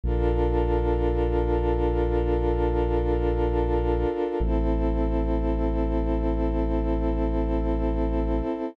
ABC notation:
X:1
M:4/4
L:1/8
Q:1/4=55
K:Bblyd
V:1 name="Pad 2 (warm)"
[DFAB]8 | [CEA]8 |]
V:2 name="Synth Bass 2" clef=bass
B,,,8 | A,,,8 |]